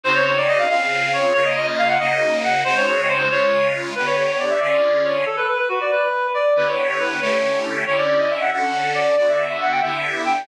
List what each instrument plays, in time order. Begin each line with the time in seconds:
0.04 accordion C#3 C4 D#4 F#4, clarinet C5
0.15 clarinet C#5
0.25 clarinet C#5
0.37 clarinet D5
0.48 clarinet D#5
0.59 clarinet F5
0.69 accordion C#3 C4 F4 G#4, clarinet F5
1.13 clarinet C#5
1.34 accordion C#3 A#3 F4, clarinet C#5
1.44 clarinet D#5
1.56 clarinet D#5
1.67 clarinet D#5
1.78 clarinet F5
1.88 clarinet F#5
1.99 accordion C#3 A#3 D#4 F#4, clarinet D#5
2.44 clarinet F#5
2.64 accordion C#3 G#3 C4 D#4 F#4, clarinet C5
2.77 clarinet C#5
2.87 clarinet C#5
2.98 clarinet C#5
3.08 clarinet C5
3.19 clarinet C5
3.30 accordion C#3 G#3 F4, clarinet C#5
3.95 accordion D3 B3 G4, clarinet B4
4.06 clarinet C#5
4.16 clarinet C#5
4.28 clarinet C#5
4.39 clarinet D5
4.50 clarinet E5
4.60 accordion D3 C#4 F4 G#4, clarinet D5
5.04 clarinet C#5
5.26 clarinet A4
5.37 clarinet B4
5.48 clarinet B4
5.58 clarinet B4
5.69 clarinet F#4
5.81 clarinet D5
5.91 clarinet B4
6.34 clarinet D5
6.56 accordion D3 B3 E4 G4, clarinet B4
6.67 clarinet C#5
6.78 clarinet C#5
6.89 clarinet C#5
7.00 clarinet B4
7.11 clarinet B4
7.21 accordion D3 A3 C#4 E4 G4, clarinet C#5
7.86 accordion D3 C#4 E4 G4, clarinet C#5
7.97 clarinet D5
8.08 clarinet D5
8.19 clarinet D#5
8.30 clarinet E5
8.41 clarinet F#5
8.52 accordion D3 C#4 F#4 A4, clarinet F#5
8.94 clarinet D5
9.17 accordion D3 B3 F#4, clarinet D5
9.29 clarinet E5
9.38 clarinet E5
9.50 clarinet E5
9.61 clarinet F#5
9.72 clarinet G5
9.82 accordion D3 B3 E4 G4, clarinet E5
10.25 clarinet G5